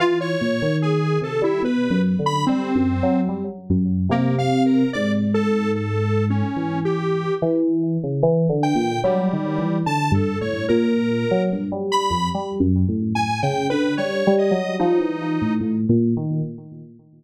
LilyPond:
<<
  \new Staff \with { instrumentName = "Electric Piano 2" } { \clef bass \time 5/4 \tempo 4 = 73 e8 bes,16 ees8. c16 g16 \tuplet 3/2 { b,8 ges,8 d8 g8 ges,8 ges8 } g16 r16 ges,8 | c4 aes,2 e4 e8. des16 | \tuplet 3/2 { e8 d8 bes,8 ges8 ees8 e8 d8 g,8 a,8 } bes,8. ges16 g,16 g8 f,16 | \tuplet 3/2 { g8 ges,8 a,8 a,8 des8 d8 g8 g8 ges8 } f16 e8 a,16 \tuplet 3/2 { a,8 bes,8 ees8 } | }
  \new Staff \with { instrumentName = "Lead 1 (square)" } { \time 5/4 f'16 des''8. aes'8 a'16 e'16 b'8 r16 b''16 c'4 r4 | \tuplet 3/2 { bes8 f''8 bes'8 } d''16 r16 a'8 \tuplet 3/2 { a'4 des'4 g'4 } r4 | r8 g''8 g4 \tuplet 3/2 { a''8 a'8 des''8 } bes'4 r8 b''8 | r4 \tuplet 3/2 { aes''8 g''8 b'8 } des''8 ees''8 ees'4 r4 | }
>>